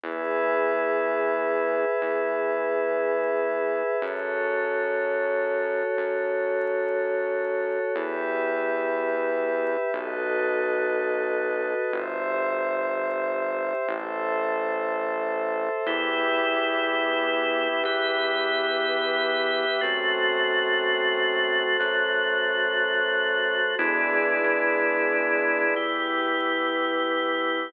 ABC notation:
X:1
M:9/8
L:1/8
Q:3/8=91
K:E
V:1 name="Drawbar Organ"
z9 | z9 | z9 | z9 |
[K:Em] z9 | z9 | z9 | z9 |
[B,EG]9 | [B,GB]9 | [A,CF]9 | [F,A,F]9 |
[^G,B,DE]9 | [E,B,G]9 |]
V:2 name="Pad 5 (bowed)"
[GBe]9- | [GBe]9 | [FAc]9- | [FAc]9 |
[K:Em] [GBe]9 | [FAB^d]9 | [Gce]9 | [Ace]9 |
[GBe]9- | [GBe]9 | [FAc]9- | [FAc]9 |
[E^GBd]9 | [EGB]9 |]
V:3 name="Synth Bass 1" clef=bass
E,,9 | E,,9 | F,,9 | F,,9 |
[K:Em] E,,9 | B,,,9 | G,,,9 | A,,,9 |
E,,9 | E,,9 | F,,9 | F,,9 |
E,,3 E,,6 | z9 |]